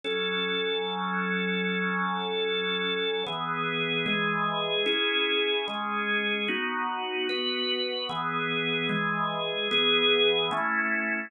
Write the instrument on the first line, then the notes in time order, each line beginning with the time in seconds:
drawbar organ
0.04 F#3 C#4 A4
3.27 E3 B3 G#4
4.06 E3 G#3 G#4
4.86 C#4 E4 G#4
5.68 G#3 C#4 G#4
6.48 B3 D#4 F#4
7.29 B3 F#4 B4
8.09 E3 B3 G#4
8.89 E3 G#3 G#4
9.71 E3 B3 G#4
10.51 A3 C#4 E4